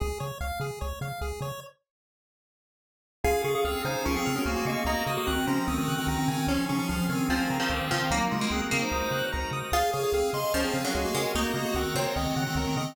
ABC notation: X:1
M:4/4
L:1/16
Q:1/4=148
K:Db
V:1 name="Lead 1 (square)"
z16 | z16 | [Af]2 [Af] [Af] [CA]2 [Ec]2 [DB] [CA]2 [DB] [B,G] [B,G] [B,G]2 | [B,G]2 [B,G] [B,G] [E,C]2 [F,D]2 [E,C] [E,C]2 [E,C] [E,C] [E,C] [E,C]2 |
[F,D]2 [F,D] [F,D] [F,D]2 [E,C]2 [E,C] [E,C]2 [E,C] [E,C] [E,C] [E,C]2 | [G,E]2 [A,F] [A,F] [CA] z [CA] [Ec]5 z4 | [Af]2 [Af] [Af] [CA]2 [ec']2 [DB] [CA]2 [DB] [B,G] [B,G] [Bg]2 | [B,G]2 [B,G] [B,G] [E,C]2 [Fd]2 [E,C] [E,C]2 [E,C] [E,C] [E,C] [E,C]2 |]
V:2 name="Pizzicato Strings"
z16 | z16 | F8 F,3 G,3 A,2 | E6 C2 z8 |
D8 F,3 F,3 F,2 | B,3 B,3 B,6 z4 | F4 z4 F,3 G,3 A,2 | E6 C2 z8 |]
V:3 name="Lead 1 (square)"
A2 d2 f2 A2 d2 f2 A2 d2 | z16 | a2 d'2 f'2 a2 d'2 f'2 a2 d'2 | b2 e'2 g'2 b2 e'2 g'2 b2 a2- |
a2 d'2 f'2 a2 a2 b2 =d'2 f'2 | b2 e'2 g'2 b2 e'2 g'2 b2 e'2 | A2 d2 f2 A2 d2 f2 A2 d2 | B2 e2 g2 B2 e2 g2 B2 e2 |]
V:4 name="Synth Bass 1" clef=bass
D,,2 D,2 D,,2 D,2 D,,2 D,2 D,,2 D,2 | z16 | D,,2 D,2 D,,2 D,2 D,,2 D,2 D,,2 D,2 | D,,2 D,2 D,,2 D,2 D,,2 D,2 D,,2 D,2 |
D,,2 D,2 D,,2 D,2 D,,2 D,2 D,,2 D,2 | D,,2 D,2 D,,2 D,2 D,,2 D,2 D,,2 D,2 | D,,2 D,2 D,,2 D,2 D,,2 D,2 D,,2 D,2 | D,,2 D,2 D,,2 D,2 D,,2 D,2 D,,2 D,2 |]
V:5 name="Drawbar Organ"
z16 | z16 | [DFA]16 | [EGB]16 |
[DFA]8 [=DFAB]8 | [EGB]16 | [dfa]16 | [egb]16 |]